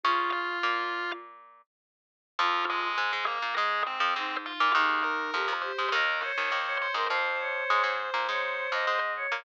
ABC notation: X:1
M:4/4
L:1/16
Q:1/4=102
K:Bbm
V:1 name="Drawbar Organ"
[Ff]2 [Ff]6 z8 | [K:Fm] [F,F]2 [A,A]4 [B,B]2 [A,A]2 [Cc]4 [Ff]2 | [Aa]2 [Bb]4 [cc']2 [Bb]2 [cc']4 [cc']2 | [cc']16 |]
V:2 name="Choir Aahs"
F8 z8 | [K:Fm] F4 z8 E4 | E4 G z G G e2 d3 d2 B | c2 d4 z2 d3 e3 d2 |]
V:3 name="Pizzicato Strings"
[D,D]4 [B,,B,]8 z4 | [K:Fm] [F,,F,]4 [A,,A,] [A,,A,]2 [B,,B,] [A,,A,]3 [F,,F,] [A,,A,]3 [B,,B,] | [E,,E,]4 [F,,F,] [F,,F,]2 [A,,A,] [E,,E,]3 [E,,E,] [E,,E,]3 [A,,A,] | [F,,F,]4 [A,,A,] [A,,A,]2 [B,,B,] [A,,A,]3 [F,,F,] [A,,A,]3 [B,,B,] |]